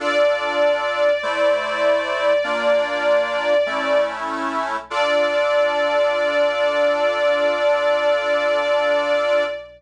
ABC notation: X:1
M:4/4
L:1/8
Q:1/4=49
K:Dm
V:1 name="String Ensemble 1"
d8 | d8 |]
V:2 name="Accordion"
[DFA]2 [A,Ec]2 [B,DF]2 [A,^CE]2 | [DFA]8 |]